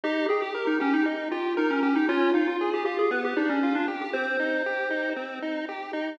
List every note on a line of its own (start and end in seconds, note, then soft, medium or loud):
0.04 0.27 D#4 loud
0.04 0.26 G4 loud
0.29 0.53 G4 medium
0.29 0.41 G#4 loud
0.42 0.65 G4 loud
0.54 0.77 A#4 medium
0.67 0.79 D#4 loud
0.80 0.93 C#4 loud
0.80 1.03 G4 medium
0.93 1.06 D#4 loud
1.05 1.29 D#4 medium
1.31 1.53 F4 medium
1.31 1.55 G4 medium
1.57 1.70 D#4 loud
1.57 1.80 A#4 medium
1.70 1.82 C#4 loud
1.82 1.95 C#4 loud
1.82 2.06 G4 medium
1.96 2.08 D#4 loud
2.09 2.32 C#4 loud
2.09 2.31 F4 loud
2.34 2.47 D#4 loud
2.34 2.57 F4 medium
2.48 2.70 F4 medium
2.61 2.84 G#4 medium
2.74 2.84 G4 loud
2.85 3.08 F4 medium
2.85 2.97 G4 loud
2.99 3.11 G#4 loud
3.11 3.34 B3 medium
3.11 3.23 B4 loud
3.25 3.37 G4 loud
3.36 3.59 D4 medium
3.36 3.49 D#4 loud
3.49 3.73 C#4 loud
3.63 3.86 F4 medium
3.75 3.87 D4 loud
3.88 4.11 G4 medium
4.01 4.14 G4 medium
4.13 4.37 C4 medium
4.13 5.10 C5 loud
4.39 4.63 D#4 medium
4.66 4.89 G4 medium
4.90 5.13 D#4 medium
5.16 5.39 C4 medium
5.42 5.65 D#4 medium
5.69 5.92 G4 medium
5.93 6.16 D#4 medium